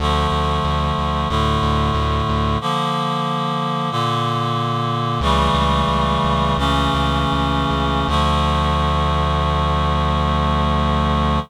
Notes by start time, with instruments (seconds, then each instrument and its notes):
0.00 synth bass 1 D2, clarinet D3 F3 A3
0.32 synth bass 1 D2
0.64 synth bass 1 D2
0.98 synth bass 1 D2
1.29 synth bass 1 D2, clarinet A2 D3 A3
1.63 synth bass 1 D2
1.94 synth bass 1 D2
2.29 synth bass 1 D2
2.61 clarinet D3 F3 A#3
3.91 clarinet A#2 D3 A#3
5.21 synth bass 1 C#2, clarinet C#3 E3 G3 A3
5.54 synth bass 1 C#2
5.88 synth bass 1 C#2
6.24 synth bass 1 C#2
6.57 synth bass 1 C#2, clarinet C#3 E3 A3 C#4
6.94 synth bass 1 C#2
7.32 synth bass 1 C#2
7.70 synth bass 1 C#2
8.08 synth bass 1 D2, clarinet D3 F3 A3